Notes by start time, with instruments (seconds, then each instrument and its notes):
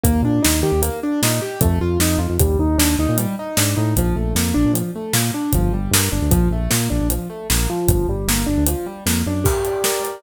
0.04 synth bass 1 D#2, acoustic grand piano A#3, kick, closed hi-hat
0.22 synth bass 1 A#2, acoustic grand piano D4
0.42 synth bass 1 D#2, acoustic grand piano D#4, snare
0.63 synth bass 1 D#3, acoustic grand piano G4
0.72 synth bass 1 D#2
0.82 acoustic grand piano A#3, closed hi-hat
1.03 acoustic grand piano D4
1.22 synth bass 1 A#2, acoustic grand piano D#4, snare
1.42 acoustic grand piano G4
1.61 synth bass 1 F2, acoustic grand piano A3, kick, closed hi-hat
1.80 synth bass 1 F2, acoustic grand piano F4
2.00 synth bass 1 F2, acoustic grand piano D#4, snare
2.18 synth bass 1 F2, acoustic grand piano F4
2.30 synth bass 1 F2
2.39 synth bass 1 D#2, acoustic grand piano G3, kick, closed hi-hat
2.59 synth bass 1 D#2, acoustic grand piano D#4
2.78 synth bass 1 D#2, acoustic grand piano D4, snare
2.98 synth bass 1 D#2, acoustic grand piano D#4
3.09 synth bass 1 A#2
3.18 acoustic grand piano G3, closed hi-hat
3.39 acoustic grand piano D#4
3.57 synth bass 1 G#2, acoustic grand piano D4, snare
3.77 synth bass 1 A2, acoustic grand piano D#4
3.96 synth bass 1 A#1, acoustic grand piano F3, kick, closed hi-hat
4.16 synth bass 1 A#1, acoustic grand piano A3
4.35 synth bass 1 F2, acoustic grand piano A#3, snare
4.54 synth bass 1 A#1, acoustic grand piano D4
4.65 synth bass 1 A#2
4.73 acoustic grand piano F3, closed hi-hat
4.95 acoustic grand piano A3
5.13 synth bass 1 A#2, acoustic grand piano A#3, snare
5.34 acoustic grand piano D4
5.53 synth bass 1 G1, acoustic grand piano F3, kick, closed hi-hat
5.71 synth bass 1 G1, acoustic grand piano G3
5.91 synth bass 1 G2, acoustic grand piano A#3, snare
6.12 synth bass 1 G1, acoustic grand piano D4
6.22 synth bass 1 D2
6.31 synth bass 1 A#1, acoustic grand piano F3, kick, closed hi-hat
6.51 synth bass 1 A#1, acoustic grand piano A3
6.71 synth bass 1 A#2, acoustic grand piano A#3, snare
6.90 synth bass 1 A#1, acoustic grand piano D4
7.01 synth bass 1 A#1
7.10 acoustic grand piano F3, closed hi-hat
7.30 acoustic grand piano A3
7.50 synth bass 1 A#1, acoustic grand piano A#3, snare
7.70 acoustic grand piano F3
7.88 synth bass 1 G1, kick, closed hi-hat
8.08 synth bass 1 G1, acoustic grand piano G3
8.28 synth bass 1 G1, acoustic grand piano A#3, snare
8.46 synth bass 1 G1, acoustic grand piano D4
8.57 synth bass 1 D2
8.67 acoustic grand piano F3, closed hi-hat
8.86 acoustic grand piano G3
9.06 synth bass 1 F2, acoustic grand piano A#3, snare
9.26 synth bass 1 F#2, acoustic grand piano D4
9.44 acoustic grand piano G4, kick, crash
9.65 acoustic grand piano D5, closed hi-hat
9.84 acoustic grand piano A#4, snare
10.03 acoustic grand piano D5, closed hi-hat